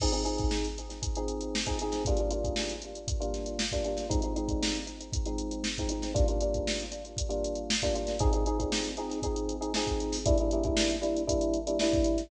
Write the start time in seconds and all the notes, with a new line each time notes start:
0.00 F3 C4 D#4 G#4, kick, crash
0.12 F3 C4 D#4 G#4, closed hi-hat
0.24 F3 C4 D#4 G#4, closed hi-hat
0.38 kick, closed hi-hat
0.51 snare
0.65 closed hi-hat
0.78 closed hi-hat
0.90 snare, closed hi-hat
1.03 kick, closed hi-hat
1.15 F3 C4 D#4 G#4, closed hi-hat
1.28 closed hi-hat
1.41 closed hi-hat
1.55 snare
1.66 F3 C4 D#4 G#4, kick, snare, closed hi-hat
1.79 F3 C4 D#4 G#4, snare, closed hi-hat
1.92 snare, closed hi-hat
2.05 G3 A#3 D4 F4, kick, closed hi-hat
2.17 G3 A#3 D4 F4, closed hi-hat
2.31 G3 A#3 D4 F4, closed hi-hat
2.44 kick, closed hi-hat
2.56 snare
2.69 closed hi-hat
2.82 closed hi-hat
2.95 closed hi-hat
3.08 kick, closed hi-hat
3.20 G3 A#3 D4 F4, closed hi-hat
3.34 snare, closed hi-hat
3.46 closed hi-hat
3.59 snare
3.72 G3 A#3 D4 F4, kick, closed hi-hat
3.84 G3 A#3 D4 F4, closed hi-hat
3.97 snare, closed hi-hat
4.09 F3 G#3 C4 D#4, kick, closed hi-hat
4.22 F3 G#3 C4 D#4, closed hi-hat
4.36 F3 G#3 C4 D#4, closed hi-hat
4.48 kick, closed hi-hat
4.63 snare
4.75 closed hi-hat
4.87 snare, closed hi-hat
5.01 closed hi-hat
5.13 kick, closed hi-hat
5.26 F3 G#3 C4 D#4, closed hi-hat
5.38 closed hi-hat
5.51 closed hi-hat
5.64 snare
5.77 F3 G#3 C4 D#4, kick, snare, closed hi-hat
5.89 F3 G#3 C4 D#4, closed hi-hat
6.02 snare, closed hi-hat
6.14 G3 A#3 D4 F4, kick, closed hi-hat
6.28 G3 A#3 D4 F4, closed hi-hat
6.41 G3 A#3 D4 F4, closed hi-hat
6.54 kick, closed hi-hat
6.67 snare
6.80 closed hi-hat
6.92 closed hi-hat
7.05 closed hi-hat
7.17 kick, closed hi-hat
7.29 G3 A#3 D4 F4, closed hi-hat
7.44 closed hi-hat
7.55 closed hi-hat
7.70 snare
7.82 G3 A#3 D4 F4, kick, closed hi-hat
7.95 G3 A#3 D4 F4, closed hi-hat
8.07 snare, closed hi-hat
8.19 F3 C4 D#4 G#4, kick, closed hi-hat
8.33 F3 C4 D#4 G#4, closed hi-hat
8.46 F3 C4 D#4 G#4, closed hi-hat
8.59 F3 C4 D#4 G#4, kick, closed hi-hat
8.72 snare
8.85 snare, closed hi-hat
8.97 F3 C4 D#4 G#4, closed hi-hat
9.10 snare, closed hi-hat
9.22 F3 C4 D#4 G#4, kick, closed hi-hat
9.36 closed hi-hat
9.49 closed hi-hat
9.61 F3 C4 D#4 G#4, closed hi-hat
9.74 F3 C4 D#4 G#4, snare
9.87 kick, closed hi-hat
10.00 closed hi-hat
10.12 snare, open hi-hat
10.26 G3 A#3 D4 E4, kick, closed hi-hat
10.38 G3 A#3 D4 E4, closed hi-hat
10.51 G3 A#3 D4 E4, closed hi-hat
10.64 G3 A#3 D4 E4, kick, closed hi-hat
10.77 snare
10.90 snare, closed hi-hat
11.01 G3 A#3 D4 E4, closed hi-hat
11.17 closed hi-hat
11.27 G3 A#3 D4 E4, kick, closed hi-hat
11.41 closed hi-hat
11.54 closed hi-hat
11.67 G3 A#3 D4 E4, closed hi-hat
11.79 G3 A#3 D4 E4, snare
11.93 kick, closed hi-hat
12.04 closed hi-hat
12.18 snare, closed hi-hat